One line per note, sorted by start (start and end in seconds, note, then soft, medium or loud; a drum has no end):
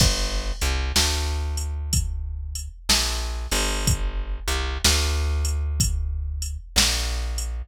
0.00 0.52 G1 loud
0.00 kick medium
0.00 crash medium
0.61 0.92 C2 medium
0.61 closed hi-hat medium
0.96 2.68 D2 medium
0.96 snare medium
1.57 closed hi-hat medium
1.93 kick medium
1.93 closed hi-hat medium
2.55 closed hi-hat medium
2.89 3.47 A#1 medium
2.89 snare medium
3.51 4.39 G1 loud
3.51 open hi-hat medium
3.87 kick medium
3.87 closed hi-hat medium
4.48 4.78 C2 medium
4.48 closed hi-hat medium
4.84 6.57 D2 loud
4.84 snare medium
5.45 closed hi-hat medium
5.80 kick medium
5.80 closed hi-hat medium
6.42 closed hi-hat medium
6.76 7.62 A#1 medium
6.76 snare loud
7.38 closed hi-hat medium